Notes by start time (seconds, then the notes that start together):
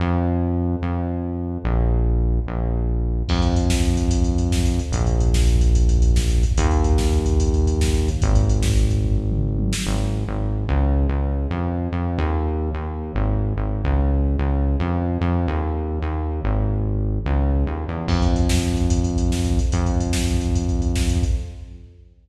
0.00 F2
0.82 F2
1.64 A#1
2.47 A#1
3.29 F2, kick, crash
3.35 kick
3.42 kick, closed hi-hat
3.49 kick
3.56 kick, closed hi-hat
3.63 kick
3.70 kick, snare
3.77 kick
3.83 kick, closed hi-hat
3.90 kick
3.97 kick, closed hi-hat
4.04 kick
4.11 kick, closed hi-hat
4.18 kick
4.24 kick, closed hi-hat
4.32 kick
4.38 kick, closed hi-hat
4.45 kick
4.52 kick, snare
4.59 kick
4.65 kick, closed hi-hat
4.73 kick
4.79 kick, closed hi-hat
4.86 kick
4.92 A#1, kick, closed hi-hat
5.00 kick
5.07 kick, closed hi-hat
5.14 kick
5.20 kick, closed hi-hat
5.28 kick
5.34 kick, snare
5.41 kick
5.47 kick, closed hi-hat
5.55 kick
5.61 kick, closed hi-hat
5.68 kick
5.75 kick, closed hi-hat
5.82 kick
5.89 kick, closed hi-hat
5.96 kick
6.02 kick, closed hi-hat
6.10 kick
6.16 kick, snare
6.23 kick
6.30 kick, closed hi-hat
6.37 kick
6.43 kick, closed hi-hat
6.51 kick
6.58 D#2, kick, closed hi-hat
6.64 kick
6.71 kick, closed hi-hat
6.78 kick
6.84 kick, closed hi-hat
6.92 kick
6.98 kick, snare
7.05 kick
7.12 kick, closed hi-hat
7.20 kick
7.26 kick, closed hi-hat
7.33 kick
7.40 kick, closed hi-hat
7.46 kick
7.54 kick, closed hi-hat
7.60 kick
7.66 kick, closed hi-hat
7.74 kick
7.81 kick, snare
7.88 kick
7.94 kick, closed hi-hat
8.02 kick
8.08 kick, closed hi-hat
8.15 kick
8.22 G#1, kick, closed hi-hat
8.29 kick
8.35 kick, closed hi-hat
8.43 kick
8.49 kick, closed hi-hat
8.56 kick
8.63 kick, snare
8.70 kick
8.76 kick, closed hi-hat
8.83 kick
8.90 kick, closed hi-hat
8.98 kick
9.04 kick, floor tom
9.18 floor tom
9.32 mid tom
9.58 high tom
9.73 snare
9.87 G#1
10.27 G#1
10.69 C#2
11.09 C#2
11.51 F2
11.92 F2
12.18 D#2
12.74 D#2
13.15 G#1
13.56 G#1
13.84 C#2
14.39 C#2
14.80 F2
15.21 F2
15.48 D#2
16.02 D#2
16.44 G#1
17.26 C#2
17.66 D#2
17.88 E2
18.08 F2, kick, crash
18.15 kick
18.22 kick, closed hi-hat
18.29 kick
18.36 kick, closed hi-hat
18.43 kick
18.49 kick, snare
18.57 kick
18.63 kick, closed hi-hat
18.70 kick
18.77 kick, closed hi-hat
18.84 kick
18.90 kick, closed hi-hat
18.97 kick
19.04 kick, closed hi-hat
19.11 kick
19.18 kick, closed hi-hat
19.25 kick
19.31 kick, snare
19.38 kick
19.45 kick, closed hi-hat
19.52 kick
19.59 kick, closed hi-hat
19.65 kick
19.72 F2, kick, closed hi-hat
19.79 kick
19.86 kick, closed hi-hat
19.93 kick
20.00 kick, closed hi-hat
20.07 kick
20.13 kick, snare
20.20 kick
20.28 kick, closed hi-hat
20.34 kick
20.41 kick, closed hi-hat
20.48 kick
20.55 kick, closed hi-hat
20.62 kick
20.69 kick, closed hi-hat
20.75 kick
20.82 kick, closed hi-hat
20.88 kick
20.96 kick, snare
21.03 kick
21.09 kick, closed hi-hat
21.16 kick
21.23 kick, closed hi-hat
21.31 kick